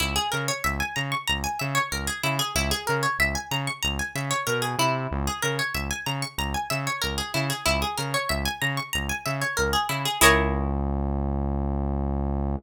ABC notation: X:1
M:4/4
L:1/16
Q:1/4=94
K:C#dor
V:1 name="Pizzicato Strings"
E G A c e g a c' a g e c A G E G | E G A c e g a c' a g e c A G E2- | E G A c e g a c' a g e c A G E G | E G A c e g a c' a g e c A G E G |
[EGAc]16 |]
V:2 name="Synth Bass 1" clef=bass
C,,2 C,2 C,,2 C,2 C,,2 C,2 C,,2 C,2 | C,,2 C,2 C,,2 C,2 C,,2 C,2 B,,2 ^B,,2 | C,,2 C,2 C,,2 C,2 C,,2 C,2 C,,2 C,2 | C,,2 C,2 C,,2 C,2 C,,2 C,2 C,,2 C,2 |
C,,16 |]